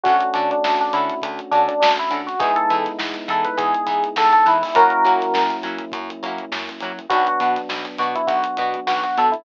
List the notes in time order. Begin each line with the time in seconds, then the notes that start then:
0.03 D2 A3 C#4 D4 F#4, kick, closed hi-hat
0.08 F#4 A4
0.20 closed hi-hat
0.33 D3 C#4 D4 F#4 A4, closed hi-hat
0.51 D4, closed hi-hat
0.64 D2, snare
0.79 D4, closed hi-hat
0.93 D3 C#4 D4 E4 F#4 A4, closed hi-hat
1.10 closed hi-hat
1.22 D2, kick, closed hi-hat
1.39 closed hi-hat
1.51 D3 C#4 D4 F#4, closed hi-hat
1.56 A4
1.68 D4, closed hi-hat
1.80 D2 D4, snare
1.97 E4, closed hi-hat
2.10 D3 C#4 D4 F#4 A4, closed hi-hat
2.27 F#4, snare, closed hi-hat
2.39 E2 G#3 B3 D#4 E4 G#4, kick, closed hi-hat
2.44 G#4
2.56 A4, closed hi-hat
2.70 E3 B3 D#4 E4, closed hi-hat
2.74 G#4
2.84 snare, closed hi-hat
2.99 E2, snare
3.14 closed hi-hat
3.28 E3 B3 D#4 E4 G#4 A4, closed hi-hat
3.45 B4, closed hi-hat
3.57 E2 G#4, kick, closed hi-hat
3.75 closed hi-hat
3.87 E3 B3 D#4 E4, kick, closed hi-hat
3.91 G#4
4.04 closed hi-hat
4.16 E2 A4, snare
4.33 A4, closed hi-hat
4.46 E3 B3 D#4 E4, closed hi-hat
4.50 G#4
4.62 E4, open hi-hat
4.75 F#2 F#3 A#3 C#4 E4 F#4 A#4, kick, closed hi-hat
4.79 F#4
4.90 closed hi-hat
5.05 F#3 A#3 C#4 E4 F#4, closed hi-hat
5.20 snare, closed hi-hat
5.34 F#2, snare
5.50 closed hi-hat
5.63 F#3 A#3 C#4 E4, closed hi-hat
5.67 F#4
5.78 closed hi-hat
5.92 F#2, kick, closed hi-hat
6.10 closed hi-hat
6.23 F#3 A#3 C#4 E4, closed hi-hat
6.27 F#4
6.38 closed hi-hat
6.52 F#2, snare
6.69 snare, closed hi-hat
6.80 F#3 A#3 C#4 E4, closed hi-hat
6.85 F#4
6.99 closed hi-hat
7.09 B1 F#3 B3 D4 F#4, kick, closed hi-hat
7.27 F#4, closed hi-hat
7.40 B2 B3 D4 F#4, closed hi-hat
7.56 snare, closed hi-hat
7.69 B1, snare
7.85 closed hi-hat
7.98 B2 B3 D4 F#4, closed hi-hat
8.02 F#4
8.15 E4, closed hi-hat
8.27 B1 F#4, kick, closed hi-hat
8.44 closed hi-hat
8.57 B2 B3 D4, closed hi-hat
8.61 F#4
8.74 closed hi-hat
8.87 B1 F#4, snare
9.03 F#4, closed hi-hat
9.17 B2 B3 D4 F#4 A4, closed hi-hat
9.32 E4, closed hi-hat